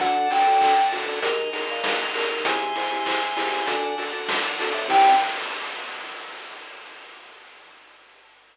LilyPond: <<
  \new Staff \with { instrumentName = "Electric Piano 2" } { \time 4/4 \key g \mixolydian \tempo 4 = 98 fis''8 g''4 r2 r8 | gis''2~ gis''8 r4. | g''4 r2. | }
  \new Staff \with { instrumentName = "Xylophone" } { \time 4/4 \key g \mixolydian <d' fis' a'>8 <d' fis' a'>8 <d' fis' a'>8 <d' fis' a'>8 <ees' aes' bes'>8 <ees' aes' bes'>8 <ees' aes' bes'>8 <ees' aes' bes'>8 | <e' gis' c''>8 <e' gis' c''>8 <e' gis' c''>8 <e' gis' c''>8 <d' fis' a'>8 <d' fis' a'>8 <d' fis' a'>8 <d' fis' a'>8 | <c' ees' g'>4 r2. | }
  \new Staff \with { instrumentName = "Drawbar Organ" } { \clef bass \time 4/4 \key g \mixolydian d,8. d,8. d,16 d,16 ees,8. bes,8. ees,16 ees,16 | c,8. c,8. c,16 c,16 d,8. d,8. d,16 a,16 | c,4 r2. | }
  \new Staff \with { instrumentName = "Drawbar Organ" } { \time 4/4 \key g \mixolydian <d'' fis'' a''>2 <ees'' aes'' bes''>2 | <e'' gis'' c'''>2 <d'' fis'' a''>2 | <c' ees' g'>4 r2. | }
  \new DrumStaff \with { instrumentName = "Drums" } \drummode { \time 4/4 <hh bd>8 <hho sn>8 <hc bd>8 hho8 <hh bd>8 hho8 <bd sn>8 hho8 | <hh bd>8 <hho sn>8 <hc bd>8 hho8 <hh bd>8 hho8 <bd sn>8 hho8 | <cymc bd>4 r4 r4 r4 | }
>>